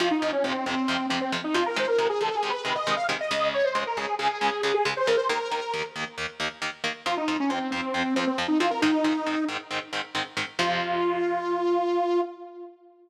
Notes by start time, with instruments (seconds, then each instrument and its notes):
0.00 overdriven guitar F2 C3 F3, lead 2 (sawtooth) F4
0.11 lead 2 (sawtooth) D#4
0.22 overdriven guitar F2 C3 F3
0.32 lead 2 (sawtooth) C#4
0.44 overdriven guitar F2 C3 F3, lead 2 (sawtooth) C4
0.66 overdriven guitar F2 C3 F3, lead 2 (sawtooth) C4
0.88 overdriven guitar F2 C3 F3
1.09 overdriven guitar F2 C3 F3, lead 2 (sawtooth) C4
1.21 lead 2 (sawtooth) C4
1.32 overdriven guitar F2 C3 F3
1.44 lead 2 (sawtooth) D#4
1.54 overdriven guitar F2 C3 F3, lead 2 (sawtooth) F4
1.66 lead 2 (sawtooth) A#4
1.76 overdriven guitar C3 D#3 G#3, lead 2 (sawtooth) C5
1.87 lead 2 (sawtooth) A#4
1.99 overdriven guitar C3 D#3 G#3
2.09 lead 2 (sawtooth) G#4
2.21 overdriven guitar C3 D#3 G#3, lead 2 (sawtooth) A4
2.35 lead 2 (sawtooth) G#4
2.43 overdriven guitar C3 D#3 G#3
2.50 lead 2 (sawtooth) B4
2.65 overdriven guitar C3 D#3 G#3, lead 2 (sawtooth) B4
2.75 lead 2 (sawtooth) D#5
2.87 overdriven guitar C3 D#3 G#3
2.96 lead 2 (sawtooth) F5
3.09 overdriven guitar C3 D#3 G#3
3.21 lead 2 (sawtooth) D#5
3.31 overdriven guitar C#2 C#3 G#3
3.54 lead 2 (sawtooth) C#5
3.64 lead 2 (sawtooth) C5
3.75 overdriven guitar C#2 C#3 G#3
3.87 lead 2 (sawtooth) A#4
3.97 overdriven guitar C#2 C#3 G#3, lead 2 (sawtooth) G#4
4.19 overdriven guitar C#2 C#3 G#3, lead 2 (sawtooth) G#4
4.41 overdriven guitar C#2 C#3 G#3
4.63 overdriven guitar C#2 C#3 G#3, lead 2 (sawtooth) G#4
4.74 lead 2 (sawtooth) G#4
4.85 overdriven guitar C#2 C#3 G#3
4.97 lead 2 (sawtooth) C5
5.06 overdriven guitar C#2 C#3 G#3, lead 2 (sawtooth) A#4
5.17 lead 2 (sawtooth) C5
5.29 overdriven guitar D#2 D#3 A#3, lead 2 (sawtooth) A#4
5.51 overdriven guitar D#2 D#3 A#3
5.74 overdriven guitar D#2 D#3 A#3
5.96 overdriven guitar D#2 D#3 A#3
6.18 overdriven guitar D#2 D#3 A#3
6.40 overdriven guitar D#2 D#3 A#3
6.62 overdriven guitar D#2 D#3 A#3
6.84 overdriven guitar D#2 D#3 A#3
7.06 overdriven guitar F2 F3 C4, lead 2 (sawtooth) F4
7.17 lead 2 (sawtooth) D#4
7.28 overdriven guitar F2 F3 C4
7.40 lead 2 (sawtooth) C#4
7.49 overdriven guitar F2 F3 C4, lead 2 (sawtooth) C4
7.71 overdriven guitar F2 F3 C4, lead 2 (sawtooth) C4
7.94 overdriven guitar F2 F3 C4
8.16 overdriven guitar F2 F3 C4, lead 2 (sawtooth) C4
8.27 lead 2 (sawtooth) C4
8.38 overdriven guitar F2 F3 C4
8.48 lead 2 (sawtooth) D#4
8.60 overdriven guitar F2 F3 C4, lead 2 (sawtooth) F4
8.71 lead 2 (sawtooth) A#4
8.82 overdriven guitar G#2 D#3 C4, lead 2 (sawtooth) D#4
9.04 overdriven guitar G#2 D#3 C4
9.26 overdriven guitar G#2 D#3 C4
9.49 overdriven guitar G#2 D#3 C4
9.71 overdriven guitar G#2 D#3 C4
9.93 overdriven guitar G#2 D#3 C4
10.15 overdriven guitar G#2 D#3 C4
10.37 overdriven guitar G#2 D#3 C4
10.59 overdriven guitar F2 C3 F3, lead 2 (sawtooth) F4